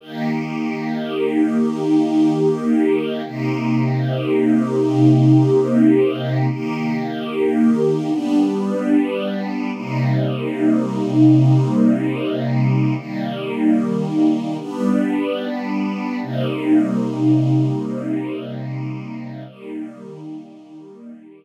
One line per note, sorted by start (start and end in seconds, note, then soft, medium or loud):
0.01 3.22 D#3 medium
0.01 3.22 A#3 medium
0.01 3.22 G4 medium
3.25 6.46 C3 medium
3.25 6.46 A#3 medium
3.25 6.46 D#4 medium
3.25 6.46 G4 medium
6.49 8.10 D#3 medium
6.49 8.10 A#3 medium
6.49 8.10 G4 medium
8.10 9.70 G3 medium
8.10 9.70 B3 medium
8.10 9.70 D4 medium
9.73 12.94 C3 medium
9.73 12.94 G3 medium
9.73 12.94 A#3 medium
9.73 12.94 D#4 medium
12.96 14.56 D#3 medium
12.96 14.56 G3 medium
12.96 14.56 A#3 medium
14.59 16.19 G3 medium
14.59 16.19 B3 medium
14.59 16.19 D4 medium
16.22 19.43 C3 medium
16.22 19.43 G3 medium
16.22 19.43 A#3 medium
16.22 19.43 D#4 medium
19.47 21.45 D#3 medium
19.47 21.45 G3 medium
19.47 21.45 A#3 medium